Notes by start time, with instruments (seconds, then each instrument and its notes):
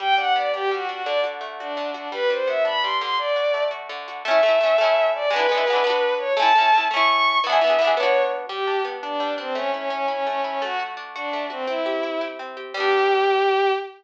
0.00 acoustic guitar (steel) G3, violin G5
0.18 acoustic guitar (steel) D4, violin F#5
0.36 acoustic guitar (steel) B3, violin D5
0.54 acoustic guitar (steel) D4, violin G4
0.71 acoustic guitar (steel) G3, violin F#4
0.89 acoustic guitar (steel) D4, violin F#4
1.04 acoustic guitar (steel) D3, violin D5
1.24 acoustic guitar (steel) F#4
1.41 acoustic guitar (steel) A3
1.59 violin D4, acoustic guitar (steel) F#4
1.77 acoustic guitar (steel) D3
1.94 violin D4, acoustic guitar (steel) F#4
2.12 acoustic guitar (steel) G3, violin B4
2.30 acoustic guitar (steel) D4, violin C5
2.47 acoustic guitar (steel) B3, violin E5
2.65 acoustic guitar (steel) D4, violin B5
2.82 acoustic guitar (steel) G3, violin C6
3.01 acoustic guitar (steel) D3, violin C6
3.18 violin D5
3.36 acoustic guitar (steel) F#4
3.54 acoustic guitar (steel) A3
3.71 acoustic guitar (steel) F#4
3.89 acoustic guitar (steel) D3
4.08 acoustic guitar (steel) F#4
4.24 acoustic guitar (steel) A3 C#4, violin E5
4.31 acoustic guitar (steel) E4
4.43 acoustic guitar (steel) A3 C#4
4.49 acoustic guitar (steel) E4
4.61 acoustic guitar (steel) A3 C#4
4.66 acoustic guitar (steel) E4
4.78 acoustic guitar (steel) A3 C#4
4.84 acoustic guitar (steel) E4
5.15 violin D5
5.30 acoustic guitar (steel) G#3 B3, violin B4
5.36 acoustic guitar (steel) D4 E4
5.49 acoustic guitar (steel) G#3 B3
5.55 acoustic guitar (steel) D4 E4
5.67 acoustic guitar (steel) G#3 B3
5.73 acoustic guitar (steel) D4 E4
5.84 acoustic guitar (steel) B3 D4
5.90 acoustic guitar (steel) F#4
6.18 violin C#5
6.37 acoustic guitar (steel) A3 C#4, violin A5
6.42 acoustic guitar (steel) E4
6.55 acoustic guitar (steel) A3 C#4
6.61 acoustic guitar (steel) E4
6.72 acoustic guitar (steel) A3 C#4
6.78 acoustic guitar (steel) E4
6.91 acoustic guitar (steel) A3 C#4, violin C#6
6.96 acoustic guitar (steel) E4
7.08 violin C#6
7.44 acoustic guitar (steel) E3 B3, violin E5
7.49 acoustic guitar (steel) D4 G#4
7.61 acoustic guitar (steel) E3 B3
7.67 acoustic guitar (steel) D4 G#4
7.79 acoustic guitar (steel) E3 B3
7.84 acoustic guitar (steel) D4 G#4
7.96 acoustic guitar (steel) B3 D4, violin C#5
8.03 acoustic guitar (steel) F#4
8.49 acoustic guitar (steel) G3, violin G4
8.67 acoustic guitar (steel) D4
8.85 acoustic guitar (steel) B3
9.03 acoustic guitar (steel) D4, violin D4
9.20 acoustic guitar (steel) G3
9.38 violin C4, acoustic guitar (steel) D4
9.55 acoustic guitar (steel) A3, violin C#4
9.74 violin C#4, acoustic guitar (steel) E4
9.90 acoustic guitar (steel) C#4, violin C#4
10.08 violin C#4, acoustic guitar (steel) E4
10.26 acoustic guitar (steel) A3, violin C#4
10.44 violin C#4, acoustic guitar (steel) E4
10.62 acoustic guitar (steel) A3, violin F#4
10.79 acoustic guitar (steel) F#4
10.97 acoustic guitar (steel) D4
11.15 violin D4, acoustic guitar (steel) F#4
11.33 acoustic guitar (steel) A3
11.50 violin C4, acoustic guitar (steel) F#4
11.67 acoustic guitar (steel) C4, violin E4
11.86 acoustic guitar (steel) G4
12.03 acoustic guitar (steel) E4
12.21 acoustic guitar (steel) G4
12.39 acoustic guitar (steel) C4
12.57 acoustic guitar (steel) G4
12.74 acoustic guitar (steel) G3 B3, violin G4
12.80 acoustic guitar (steel) D4